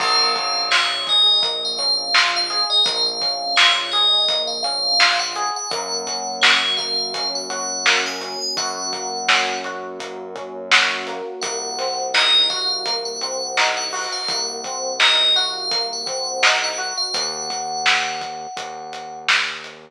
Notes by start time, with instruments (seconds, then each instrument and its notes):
0.00 synth bass 1 A#1, electric piano 1 A#3, tubular bells F5, kick, crash
0.36 electric piano 1 C#4, kick, closed hi-hat
0.71 electric piano 1 F4, tubular bells C#5, snare
1.07 electric piano 1 G#4, tubular bells D#5, kick, closed hi-hat
1.42 electric piano 1 A#3, kick, closed hi-hat
1.65 tubular bells F5
1.78 electric piano 1 C#4, tubular bells F5, closed hi-hat
2.14 electric piano 1 F4, snare
2.36 tubular bells F5
2.50 electric piano 1 G#4, closed hi-hat
2.70 tubular bells D#5
2.85 synth bass 1 A#1, electric piano 1 A#3, tubular bells F5, kick, closed hi-hat
3.21 electric piano 1 C#4, kick, closed hi-hat
3.56 electric piano 1 F4, tubular bells C#5, snare
3.92 electric piano 1 G#4, tubular bells D#5, closed hi-hat
4.29 electric piano 1 A#3, kick, closed hi-hat
4.47 tubular bells F5
4.63 electric piano 1 C#4, tubular bells F5, closed hi-hat
5.00 electric piano 1 F4, snare
5.19 tubular bells F#5
5.36 electric piano 1 G#4, closed hi-hat
5.56 tubular bells F#5
5.70 synth bass 1 F#2, electric piano 1 A#3, tubular bells F#5, kick, closed hi-hat
6.07 electric piano 1 C#4, kick, closed hi-hat
6.42 electric piano 1 F#4, tubular bells C#5, snare
6.77 electric piano 1 A#3, tubular bells F5, kick, closed hi-hat
7.14 electric piano 1 C#4, kick, closed hi-hat
7.35 tubular bells F#5
7.50 electric piano 1 F#4, tubular bells F#5, closed hi-hat
7.86 electric piano 1 A#3, snare
8.06 tubular bells G#5
8.21 electric piano 1 C#4, closed hi-hat
8.41 tubular bells G#5
8.57 synth bass 1 F#2, electric piano 1 F#4, tubular bells F#5, kick, closed hi-hat
8.93 electric piano 1 A#3, kick, closed hi-hat
9.29 electric piano 1 C#4, snare
9.64 electric piano 1 F#4, closed hi-hat
10.00 electric piano 1 A#3, kick, closed hi-hat
10.35 electric piano 1 C#4, kick, closed hi-hat
10.71 electric piano 1 F#4, snare
11.07 electric piano 1 A#3, closed hi-hat
11.42 synth bass 1 C2, electric piano 1 A#3, tubular bells F#5, kick, closed hi-hat
11.78 electric piano 1 C4, snare, closed hi-hat
12.14 electric piano 1 D#4, tubular bells D#5, snare
12.50 electric piano 1 F#4, tubular bells F5, kick, closed hi-hat
12.86 electric piano 1 A#3, kick, closed hi-hat
13.05 tubular bells F#5
13.21 electric piano 1 C4, tubular bells F#5, closed hi-hat
13.57 electric piano 1 D#4, snare
13.77 tubular bells F#5
13.93 electric piano 1 F#4, open hi-hat
14.12 tubular bells F5
14.28 synth bass 1 C2, electric piano 1 A#3, tubular bells F#5, kick, closed hi-hat
14.64 electric piano 1 C4, kick, closed hi-hat
15.00 electric piano 1 D#4, tubular bells D#5, snare
15.36 electric piano 1 F#4, tubular bells F5, closed hi-hat
15.71 electric piano 1 A#3, kick, closed hi-hat
15.93 tubular bells F#5
16.06 electric piano 1 C4, tubular bells F#5, kick, closed hi-hat
16.43 electric piano 1 D#4, snare
16.64 tubular bells F#5
16.78 electric piano 1 F#4, closed hi-hat
16.97 tubular bells F5
17.14 synth bass 1 D#2, tubular bells F#5, kick, closed hi-hat
17.50 kick, closed hi-hat
17.86 snare
18.21 kick, closed hi-hat
18.57 synth bass 1 D#2, kick, closed hi-hat
18.93 closed hi-hat
19.29 snare
19.64 closed hi-hat